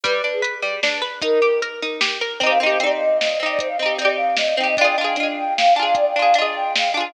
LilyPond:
<<
  \new Staff \with { instrumentName = "Flute" } { \time 3/4 \key c \minor \tempo 4 = 152 b'8. aes'16 r2 | bes'4 r2 | c''16 f''16 ees''8 d''16 r16 ees''8 ees''8 ees''16 d''16 | c''16 f''16 ees''8 d''16 r16 f''8 ees''8 g''16 ees''16 |
d''16 g''16 f''8 ees''16 r16 g''8 f''8 aes''16 f''16 | d''16 g''16 f''8 ees''16 r16 g''8 f''8 aes''16 f''16 | }
  \new Staff \with { instrumentName = "Pizzicato Strings" } { \time 3/4 \key c \minor g8 d'8 b'8 g8 d'8 b'8 | ees'8 g'8 bes'8 ees'8 g'8 bes'8 | <c' ees' g'>8 <c' ees' g'>8 <c' ees' g'>4. <c' ees' g'>8~ | <c' ees' g'>8 <c' ees' g'>8 <c' ees' g'>4. <c' ees' g'>8 |
<d' f' aes'>8 <d' f' aes'>8 <d' f' aes'>4. <d' f' aes'>8~ | <d' f' aes'>8 <d' f' aes'>8 <d' f' aes'>4. <d' f' aes'>8 | }
  \new DrumStaff \with { instrumentName = "Drums" } \drummode { \time 3/4 <hh bd>4 hh4 sn4 | <hh bd>4 hh4 sn4 | <hh bd>4 hh4 sn4 | <hh bd>4 hh4 sn4 |
<hh bd>4 hh4 sn4 | <hh bd>4 hh4 sn4 | }
>>